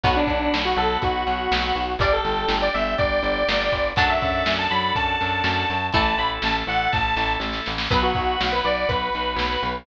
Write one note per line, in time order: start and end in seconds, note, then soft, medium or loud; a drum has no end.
0.03 0.24 B1 medium
0.03 1.81 F#3 medium
0.03 1.81 B3 loud
0.03 1.81 B3 medium
0.03 0.15 F#4 medium
0.03 1.81 F#4 loud
0.03 kick loud
0.03 crash loud
0.16 0.57 D4 medium
0.27 0.48 B1 medium
0.27 kick medium
0.27 closed hi-hat medium
0.54 0.74 B1 medium
0.54 snare loud
0.65 0.77 F#4 medium
0.76 0.97 B1 medium
0.76 0.97 A4 medium
0.76 closed hi-hat medium
1.02 1.24 B1 medium
1.02 1.93 F#4 medium
1.02 kick loud
1.02 closed hi-hat loud
1.27 1.48 B1 medium
1.27 closed hi-hat medium
1.51 1.72 B1 medium
1.51 snare loud
1.75 1.96 B1 medium
1.75 closed hi-hat medium
1.99 2.20 G1 medium
1.99 3.78 G3 medium
1.99 3.78 D4 loud
1.99 3.78 D4 medium
1.99 3.78 G4 loud
1.99 2.12 D5 medium
1.99 kick loud
1.99 closed hi-hat loud
2.13 2.58 A4 medium
2.24 2.45 G1 medium
2.24 closed hi-hat medium
2.48 2.69 G1 medium
2.48 snare loud
2.62 2.73 D5 medium
2.74 2.95 G1 medium
2.74 2.94 E5 medium
2.74 closed hi-hat medium
2.98 3.20 G1 medium
2.98 3.88 D5 medium
2.98 kick loud
2.98 closed hi-hat loud
3.23 3.43 G1 medium
3.23 closed hi-hat medium
3.48 3.69 G1 medium
3.48 snare loud
3.72 3.93 G1 medium
3.72 kick medium
3.72 closed hi-hat medium
3.96 4.18 F#2 medium
3.96 5.74 F#3 medium
3.96 5.74 A3 medium
3.96 5.73 D4 loud
3.96 5.74 D4 medium
3.96 5.73 F#4 medium
3.96 5.73 A4 loud
3.96 4.09 A5 medium
3.96 kick loud
3.96 closed hi-hat loud
4.09 4.53 E5 medium
4.22 4.43 F#2 medium
4.22 kick loud
4.22 closed hi-hat medium
4.46 4.67 F#2 medium
4.46 snare loud
4.59 4.70 A5 medium
4.70 4.92 F#2 medium
4.70 4.92 B5 medium
4.70 closed hi-hat medium
4.95 5.16 F#2 medium
4.95 5.86 A5 medium
4.95 kick loud
4.95 closed hi-hat loud
5.21 5.42 F#2 medium
5.21 closed hi-hat medium
5.44 5.65 F#2 medium
5.44 snare loud
5.69 5.91 F#2 medium
5.69 closed hi-hat medium
5.92 6.15 A1 medium
5.92 7.71 E3 medium
5.92 7.71 A3 medium
5.92 7.71 E4 loud
5.92 7.71 A4 loud
5.92 6.17 A5 medium
5.92 kick loud
5.92 closed hi-hat loud
6.18 6.39 A1 medium
6.18 6.30 B5 medium
6.18 closed hi-hat medium
6.42 6.64 A1 medium
6.42 6.55 A5 medium
6.42 snare loud
6.67 6.88 A1 medium
6.67 6.90 F#5 medium
6.67 closed hi-hat medium
6.92 7.14 A1 medium
6.92 7.33 A5 medium
6.92 kick loud
6.92 snare medium
7.16 7.37 A1 medium
7.16 snare medium
7.40 7.61 A1 medium
7.40 snare medium
7.53 snare medium
7.66 7.88 A1 medium
7.66 snare loud
7.78 snare loud
7.90 8.12 B1 medium
7.90 9.68 F#3 medium
7.90 9.68 B3 medium
7.90 9.68 F#4 loud
7.90 8.02 B4 medium
7.90 9.68 B4 loud
7.90 kick loud
7.90 crash loud
8.03 8.46 F#4 medium
8.14 8.37 B1 medium
8.14 kick loud
8.14 closed hi-hat medium
8.41 8.61 B1 medium
8.41 snare loud
8.52 8.64 B4 medium
8.64 8.85 B1 medium
8.64 8.87 D5 medium
8.64 closed hi-hat medium
8.89 9.10 B1 medium
8.89 9.75 B4 medium
8.89 kick loud
8.89 closed hi-hat loud
9.13 9.36 B1 medium
9.13 closed hi-hat medium
9.36 9.57 B1 medium
9.36 snare loud
9.63 9.84 B1 medium
9.63 closed hi-hat medium